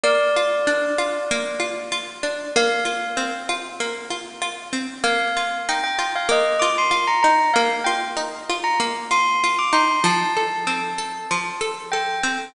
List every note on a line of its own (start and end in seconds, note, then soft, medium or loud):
0.04 1.30 A#3 medium
0.04 1.79 D5 loud
0.36 0.98 F4 medium
0.67 2.23 D4 medium
0.98 1.59 F4 medium
1.31 2.50 A#3 medium
1.60 1.91 F4 medium
1.92 2.51 F4 medium
2.23 2.53 D4 medium
2.56 3.80 A#3 medium
2.56 3.34 F5 loud
2.85 3.48 F4 medium
3.17 4.72 C4 medium
3.49 4.10 F4 medium
3.80 4.99 A#3 medium
4.10 4.41 F4 medium
4.42 5.01 F4 medium
4.73 5.02 C4 medium
5.04 6.28 A#3 medium
5.04 5.58 F5 loud
5.37 5.98 F4 medium
5.69 7.23 D#4 medium
5.69 5.83 G5 medium
5.84 6.10 G5 medium
5.99 6.61 F4 medium
6.15 6.30 F5 medium
6.29 7.47 A#3 medium
6.29 6.61 D#5 medium
6.59 6.90 F4 medium
6.59 6.74 D6 medium
6.78 7.07 C6 medium
6.91 7.50 F4 medium
7.07 7.22 A#5 medium
7.23 7.54 D#4 medium
7.23 7.51 A#5 medium
7.54 8.79 A#3 medium
7.54 7.68 F5 medium
7.84 8.49 F4 medium
7.84 7.99 G5 medium
8.17 9.72 D#4 medium
8.49 9.10 F4 medium
8.64 8.79 A#5 medium
8.80 9.98 A#3 medium
9.11 9.43 F4 medium
9.11 9.56 C6 medium
9.44 10.03 F4 medium
9.59 9.73 D6 medium
9.73 10.02 D#4 medium
9.73 10.00 C6 medium
10.04 11.30 F3 medium
10.04 11.74 A5 medium
10.37 10.98 A4 medium
10.67 12.23 C4 medium
10.98 11.60 A4 medium
11.31 12.49 F3 medium
11.61 11.93 A4 medium
11.92 12.52 A4 medium
11.92 12.42 G5 medium
12.23 12.53 C4 medium